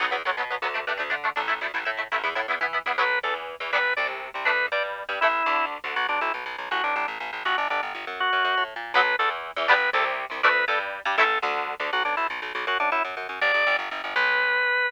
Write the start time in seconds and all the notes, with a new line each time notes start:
0.00 B1 F#3 B3
0.11 E2 F#3 B3
0.25 B1 F#3 B3
0.37 B2 F#3 B3
0.50 F#3 B3
0.62 D2 F#3 B3
0.74 A3 D4
0.87 G2 A3 D4
0.97 D2 A3 D4
1.10 D3 A3 D4
1.24 A3 D4
1.36 A1 A3 D4
1.48 A3 E4
1.61 D2 A3 E4
1.74 A1 A3 E4
1.85 A2 A3 E4
1.97 A3 E4
2.12 A1 A3 E4
2.23 E2 B3 E4
2.35 A2 B3 E4
2.48 E2 B3 E4
2.61 E3 B3 E4
2.73 B3 E4
2.86 E2 B3 E4
2.98 B1 F#3 B3 B4
3.23 E2 E3 A4
3.60 E2 E3
3.73 G1 G3 B3 D4 B4
3.97 C2 C3 D5
4.34 C2 C3
4.45 D2 A3 D4 B4
4.72 G2 G3 D5
5.09 G2 G3
5.21 A1 A3 E4
5.46 D2 D3
5.84 D2 D3
5.96 B1 F#4
6.09 B1 D4
6.21 B1 E4
6.34 B1
6.46 B1
6.58 B1
6.71 A1 F#4
6.84 A1 D4
6.96 A1 D4
7.08 A1
7.20 A1
7.33 A1
7.45 G1 F#4
7.58 G1 D4
7.70 G1 D4
7.83 G1
7.95 G1
8.07 F#2
8.20 F#4
8.33 F#2
8.45 F#2
8.57 A2
8.76 A#2
8.94 B1 F#3 B3 B4
9.19 E2 E3 A4
9.56 E2 E3
9.68 G1 G3 B3 D4 B4
9.93 C2 C3 A4
10.30 C2 C3
10.43 D2 A3 D4 B4
10.68 G2 G3 A4
11.05 G2 G3
11.18 A1 A3 E4 A4
11.42 D2 D3
11.80 D2 D3
11.93 B1 F#4
12.05 B1 D4
12.17 B1 E4
12.30 B1
12.42 B1
12.55 B1
12.67 F#2 F#4
12.80 F#2 D4
12.92 F#2 E4
13.05 F#2
13.17 F#2
13.29 F#2
13.41 G1 D5
13.54 G1
13.67 G1
13.79 G1
13.91 G1
14.04 G1
14.16 B1 B4